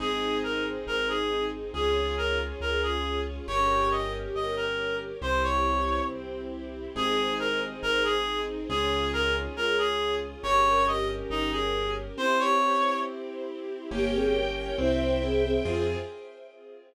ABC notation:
X:1
M:2/4
L:1/16
Q:1/4=69
K:Fm
V:1 name="Clarinet"
A2 B z B A2 z | A2 B z B A2 z | d2 e z e B2 z | c d3 z4 |
A2 B z B A2 z | A2 B z B A2 z | d2 e z E A2 z | c d3 z4 |
z8 | z8 |]
V:2 name="Flute"
z8 | z8 | z8 | z8 |
z8 | z8 | z8 | z8 |
[B,G] [CA] z2 [=Ec]2 [CA] [CA] | F4 z4 |]
V:3 name="Acoustic Grand Piano"
[CEA]8 | [DFA]8 | [DGB]8 | [C=EG]8 |
[CEA]8 | [DFA]8 | [DGB]8 | [C=EG]8 |
[B,DG]4 C2 =E2 | [CFA]4 z4 |]
V:4 name="String Ensemble 1"
[CEA]8 | [DFA]8 | [DGB]8 | [C=EG]8 |
[CEA]8 | [DFA]8 | [DGB]8 | [C=EG]8 |
[Bdg]4 [c=eg]4 | [CFA]4 z4 |]
V:5 name="Acoustic Grand Piano" clef=bass
A,,,4 A,,,4 | D,,4 D,,4 | G,,,4 G,,,4 | C,,4 C,,4 |
A,,,4 A,,,4 | D,,4 D,,4 | G,,,4 G,,,4 | z8 |
G,,,4 C,,4 | F,,4 z4 |]